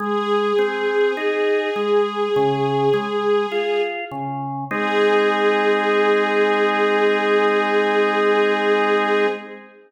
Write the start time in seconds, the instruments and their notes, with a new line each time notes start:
0.00 drawbar organ G#3, string ensemble 1 G#4
0.59 drawbar organ C4
1.17 drawbar organ D#4
1.76 drawbar organ G#3
2.36 drawbar organ C#3
2.93 drawbar organ G#3
3.52 drawbar organ F4
4.12 drawbar organ C#3
4.70 drawbar organ G#3 C4 D#4, string ensemble 1 G#4